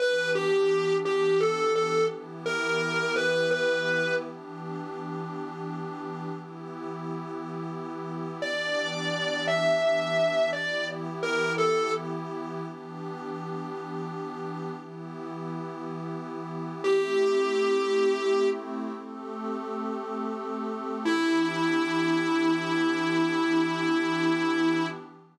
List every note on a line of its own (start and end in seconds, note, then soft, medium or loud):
0.00 2.08 E3 loud
0.00 2.08 B3 medium
0.00 2.08 D4 medium
0.00 2.08 G4 loud
0.00 0.31 B4 medium
0.35 0.95 G4 medium
1.05 1.39 G4 medium
1.40 1.72 A4 medium
1.75 2.04 A4 medium
2.11 4.20 E3 medium
2.11 4.20 B3 loud
2.11 4.20 E4 loud
2.11 4.20 G4 loud
2.46 3.14 A#4 medium
3.16 3.50 B4 medium
3.51 4.14 B4 medium
4.22 6.30 E3 medium
4.22 6.30 B3 medium
4.22 6.30 D4 loud
4.22 6.30 G4 loud
6.31 8.39 E3 medium
6.31 8.39 B3 loud
6.31 8.39 E4 medium
6.31 8.39 G4 medium
8.41 10.49 E3 loud
8.41 10.49 B3 medium
8.41 10.49 D4 loud
8.41 10.49 G4 medium
8.41 9.45 D5 medium
9.48 10.49 E5 medium
10.53 12.61 E3 medium
10.53 12.61 B3 loud
10.53 12.63 E4 loud
10.53 12.61 G4 loud
10.53 10.87 D5 medium
11.23 11.53 A#4 medium
11.58 11.92 A4 medium
12.62 14.70 E3 medium
12.62 14.70 B3 loud
12.62 14.70 D4 medium
12.62 14.70 G4 loud
14.74 16.82 E3 medium
14.74 16.82 B3 loud
14.74 16.82 E4 medium
14.74 16.82 G4 medium
16.83 18.91 A3 loud
16.83 18.91 C4 loud
16.83 18.91 E4 medium
16.83 18.91 G4 medium
16.83 18.48 G4 medium
18.95 21.04 A3 loud
18.95 21.04 C4 medium
18.95 21.04 G4 loud
18.95 21.04 A4 loud
21.05 24.86 E3 loud
21.05 24.86 B3 medium
21.05 24.86 D4 medium
21.05 24.86 E4 loud
21.05 24.86 G4 loud